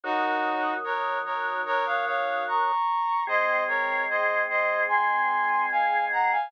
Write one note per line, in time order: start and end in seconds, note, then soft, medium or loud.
0.03 2.72 D#3 loud
0.03 2.72 F#3 loud
0.03 0.74 D#4 medium
0.03 0.74 F#4 medium
0.84 1.19 A#4 medium
0.84 1.19 C#5 medium
1.25 1.61 A#4 medium
1.25 1.61 C#5 medium
1.65 1.85 A#4 medium
1.65 1.85 C#5 medium
1.86 2.05 C#5 medium
1.86 2.05 F5 medium
2.06 2.44 C#5 medium
2.06 2.44 F5 medium
2.47 3.24 A#5 medium
2.47 3.24 C#6 medium
3.27 6.36 G#3 loud
3.27 6.36 C4 loud
3.27 3.64 C5 medium
3.27 3.64 D#5 medium
3.68 4.04 A#4 medium
3.68 4.04 C#5 medium
4.10 4.42 C5 medium
4.10 4.42 D#5 medium
4.49 4.83 C5 medium
4.49 4.83 D#5 medium
4.88 5.66 G#5 medium
4.88 5.66 C6 medium
5.71 6.05 F5 medium
5.71 6.05 G#5 medium
6.12 6.31 F#5 medium
6.12 6.31 A#5 medium
6.31 6.51 F5 medium
6.31 6.51 G#5 medium